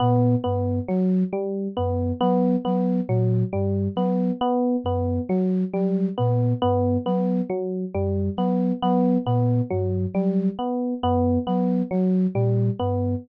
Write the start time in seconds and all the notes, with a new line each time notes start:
0.00 A#2 B3
0.44 G2 B3
0.88 F#3
1.33 G3
1.77 F#2 B3
2.21 F#3 B3
2.65 F#3 B3
3.08 A#2 F#3
3.53 G2 G3
3.96 F#3 B3
4.41 B3
4.84 F#2 B3
5.29 F#3
5.74 F#3 G3
6.18 A#2 B3
6.62 G2 B3
7.06 F#3 B3
7.50 F#3
7.94 F#2 G3
8.37 F#3 B3
8.82 F#3 B3
9.26 A#2 B3
9.70 G2 F#3
10.14 F#3 G3
10.59 B3
11.03 F#2 B3
11.47 F#3 B3
11.91 F#3
12.35 A#2 G3
12.79 G2 B3